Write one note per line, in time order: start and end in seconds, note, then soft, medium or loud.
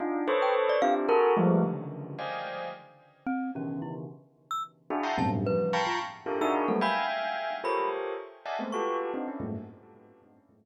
0.00 0.25 D4 medium
0.00 0.25 D#4 medium
0.00 0.25 F4 medium
0.28 0.77 A4 loud
0.28 0.77 B4 loud
0.28 0.77 C5 loud
0.28 0.77 C#5 loud
0.42 0.55 G5 medium
0.69 0.82 D5 loud
0.82 1.07 C4 medium
0.82 1.07 D4 medium
0.82 1.07 E4 medium
0.82 1.07 F4 medium
0.82 1.07 G4 medium
0.82 0.94 F5 loud
1.09 1.33 F#4 loud
1.09 1.33 G#4 loud
1.09 1.33 A4 loud
1.09 1.33 A#4 loud
1.37 1.61 F3 loud
1.37 1.61 G3 loud
1.37 1.61 G#3 loud
1.37 1.61 A3 loud
1.63 2.12 C#3 medium
1.63 2.12 D3 medium
1.63 2.12 D#3 medium
1.63 2.12 E3 medium
2.19 2.68 C5 medium
2.19 2.68 D5 medium
2.19 2.68 D#5 medium
2.19 2.68 F5 medium
2.19 2.68 G5 medium
2.19 2.68 G#5 medium
3.26 3.51 C4 loud
3.55 4.04 B2 medium
3.55 4.04 C#3 medium
3.55 4.04 D#3 medium
3.55 4.04 E3 medium
3.55 3.80 C#4 medium
3.82 3.94 E4 medium
4.51 4.63 E6 medium
4.90 5.03 D4 medium
4.90 5.03 E4 medium
4.90 5.03 F#4 medium
4.90 5.03 G#4 medium
5.03 5.16 E5 medium
5.03 5.16 F#5 medium
5.03 5.16 G5 medium
5.03 5.16 A5 medium
5.03 5.16 A#5 medium
5.03 5.16 C6 medium
5.18 5.42 F#2 loud
5.18 5.42 G2 loud
5.18 5.42 A2 loud
5.18 5.42 B2 loud
5.18 5.42 C3 loud
5.18 5.31 A5 medium
5.46 5.71 C#3 medium
5.46 5.71 D#3 medium
5.46 5.71 E3 medium
5.46 5.71 F3 medium
5.46 5.71 G3 medium
5.46 5.83 B4 medium
5.73 5.98 F5 medium
5.73 5.98 G5 medium
5.73 5.98 A5 medium
5.73 5.98 A#5 medium
5.73 5.98 B5 medium
5.73 5.98 C#6 medium
5.87 5.99 F4 medium
6.26 6.38 D4 medium
6.26 6.38 E4 medium
6.26 6.38 F4 medium
6.26 6.38 G4 medium
6.26 6.38 A4 medium
6.26 6.38 A#4 medium
6.41 6.66 D4 loud
6.41 6.66 D#4 loud
6.41 6.66 E4 loud
6.41 6.66 F#4 loud
6.41 6.66 G#4 loud
6.41 6.66 A#4 loud
6.41 6.54 E6 medium
6.68 6.81 F#3 medium
6.68 6.81 G3 medium
6.68 6.81 A3 medium
6.68 6.81 A#3 medium
6.68 6.81 B3 medium
6.68 6.80 A4 medium
6.81 7.55 E5 medium
6.81 7.55 F5 medium
6.81 7.55 G5 medium
6.81 7.55 G#5 medium
6.81 7.07 B5 medium
7.64 8.13 F4 medium
7.64 8.13 G4 medium
7.64 8.13 A4 medium
7.64 8.13 A#4 medium
7.64 8.13 C5 medium
7.64 8.13 C#5 medium
7.64 7.89 B5 medium
8.46 8.58 D5 medium
8.46 8.58 D#5 medium
8.46 8.58 E5 medium
8.46 8.58 F#5 medium
8.46 8.58 G#5 medium
8.46 8.58 A5 medium
8.59 8.71 G#3 medium
8.59 8.71 A3 medium
8.59 8.71 B3 medium
8.59 8.71 C4 medium
8.72 9.10 F4 medium
8.72 9.10 F#4 medium
8.72 9.10 G4 medium
8.72 9.10 A4 medium
8.72 9.10 B4 medium
8.72 8.97 C#6 medium
9.14 9.26 C4 medium
9.14 9.26 D4 medium
9.14 9.26 D#4 medium
9.28 9.40 C#4 medium
9.28 9.40 D4 medium
9.28 9.40 E4 medium
9.40 9.52 F#2 medium
9.40 9.52 G2 medium
9.40 9.52 G#2 medium
9.40 9.52 A2 medium
9.40 9.52 A#2 medium